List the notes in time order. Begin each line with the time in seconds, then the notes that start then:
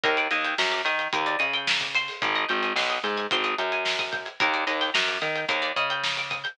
0.04 D#2 A#4, kick, closed hi-hat
0.17 D5, closed hi-hat
0.31 D#2 D#5, snare, closed hi-hat
0.45 G5, closed hi-hat
0.58 F#2 A#5, snare
0.72 D6, closed hi-hat
0.85 D#3 D#6, closed hi-hat
0.99 G6, closed hi-hat
1.13 D#2 A#4, kick, closed hi-hat
1.26 D5, closed hi-hat
1.39 C#3 D#5, closed hi-hat
1.54 G5, closed hi-hat
1.67 A#5, snare
1.81 D6, kick, snare, closed hi-hat
1.95 C5, closed hi-hat
2.08 open hi-hat
2.22 G#1, kick, closed hi-hat
2.35 D#5, closed hi-hat
2.49 G#1 G5, closed hi-hat
2.63 G#5, closed hi-hat
2.76 B1 C6, snare
2.90 D#6, closed hi-hat
3.04 G#2 G6, closed hi-hat
3.17 G#6, closed hi-hat
3.31 G#1 C5, kick, closed hi-hat
3.44 D#5, closed hi-hat
3.58 F#2 G5, closed hi-hat
3.72 G#5, closed hi-hat
3.85 C6, snare
3.99 D#6, kick, snare, closed hi-hat
4.12 G6, kick, closed hi-hat
4.25 G#6, closed hi-hat
4.40 D#2 A#4, kick, closed hi-hat
4.54 D5, closed hi-hat
4.67 D#2 D#5, snare, closed hi-hat
4.81 G5, snare, closed hi-hat
4.94 F#2 A#5, snare
5.07 D6, snare, closed hi-hat
5.21 D#3 D#6, closed hi-hat
5.36 G6, closed hi-hat
5.48 D#2 A#4, kick, closed hi-hat
5.62 D5, closed hi-hat
5.76 C#3 D#5, closed hi-hat
5.90 G5, closed hi-hat
6.03 A#5, snare
6.17 D6, snare, closed hi-hat
6.30 D#6, kick, closed hi-hat
6.44 G6, closed hi-hat